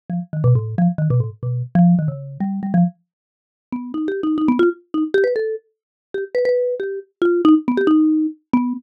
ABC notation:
X:1
M:2/4
L:1/16
Q:1/4=137
K:none
V:1 name="Marimba"
z F, z _E, B,, A,,2 F, | z _E, B,, A,, z B,,2 z | F,2 _E, _D,3 G,2 | G, F, z6 |
z2 B,2 (3_E2 G2 E2 | _E B, F z2 E z G | B A2 z5 | G z B B3 G2 |
z2 F2 _E z B, G | _E4 z2 B,2 |]